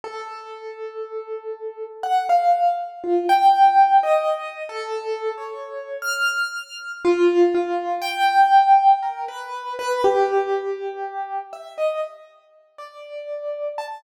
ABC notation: X:1
M:2/4
L:1/16
Q:1/4=60
K:none
V:1 name="Acoustic Grand Piano"
A8 | ^f =f2 z F g3 | (3^d4 A4 ^c4 | f'4 F2 F2 |
g4 ^A B2 B | G6 e ^d | z3 d4 a |]